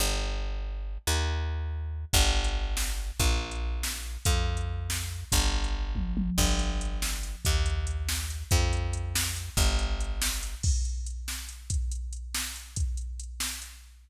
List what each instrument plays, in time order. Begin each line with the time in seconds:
0.00 electric bass (finger) G1
1.07 electric bass (finger) D#2
2.13 electric bass (finger) G1, kick, crash
2.44 closed hi-hat
2.77 snare
3.20 electric bass (finger) A#1, kick, closed hi-hat
3.51 closed hi-hat
3.83 snare
4.25 electric bass (finger) F2, kick, closed hi-hat
4.57 closed hi-hat
4.90 snare
5.32 electric bass (finger) G1, kick, closed hi-hat
5.64 closed hi-hat
5.95 kick, high tom
6.17 high tom
6.38 electric bass (finger) G1, kick, crash
6.59 closed hi-hat
6.81 closed hi-hat
7.02 snare
7.23 closed hi-hat
7.45 electric bass (finger) D#2, kick, closed hi-hat
7.66 closed hi-hat
7.87 closed hi-hat
8.09 snare
8.30 closed hi-hat
8.51 electric bass (finger) F2, kick, closed hi-hat
8.73 closed hi-hat
8.93 closed hi-hat
9.15 snare
9.36 closed hi-hat
9.57 electric bass (finger) G1, kick, closed hi-hat
9.79 closed hi-hat
10.01 closed hi-hat
10.22 snare
10.43 closed hi-hat
10.63 kick, crash
10.85 closed hi-hat
11.06 closed hi-hat
11.28 snare
11.49 closed hi-hat
11.70 kick, closed hi-hat
11.92 closed hi-hat
12.13 closed hi-hat
12.34 snare
12.56 closed hi-hat
12.76 kick, closed hi-hat
12.97 closed hi-hat
13.20 closed hi-hat
13.40 snare
13.62 closed hi-hat